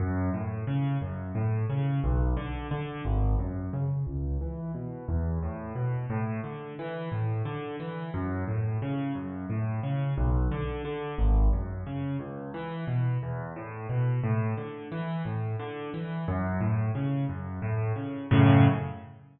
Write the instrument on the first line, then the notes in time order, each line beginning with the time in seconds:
acoustic grand piano
0.00 F#2
0.34 A2
0.67 C#3
1.02 F#2
1.35 A2
1.70 C#3
2.04 B1
2.37 D3
2.71 D3
3.05 G#1
3.39 F#2
3.73 C#3
4.07 C#2
4.41 E3
4.74 B2
5.08 E2
5.42 A2
5.75 B2
6.10 A2
6.44 D3
6.79 E3
7.12 A2
7.45 D3
7.80 E3
8.14 F#2
8.48 A2
8.82 C#3
9.15 F#2
9.50 A2
9.83 C#3
10.17 B1
10.51 D3
10.85 D3
11.18 G#1
11.53 F#2
11.86 C#3
12.20 C#2
12.54 E3
12.87 B2
13.23 E2
13.56 A2
13.89 B2
14.23 A2
14.57 D3
14.92 E3
15.25 A2
15.59 D3
15.94 E3
16.28 F#2
16.61 A2
16.95 C#3
17.29 F#2
17.62 A2
17.96 C#3
18.31 F#2 A2 C#3